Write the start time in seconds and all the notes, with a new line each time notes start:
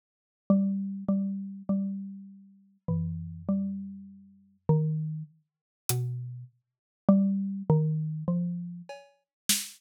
0.50 G3
1.08 G3
1.69 G3
2.88 E3, floor tom
3.48 G3
4.69 D#3
5.89 B2, closed hi-hat
7.08 G3
7.70 D#3
8.28 F3
8.89 cowbell
9.49 snare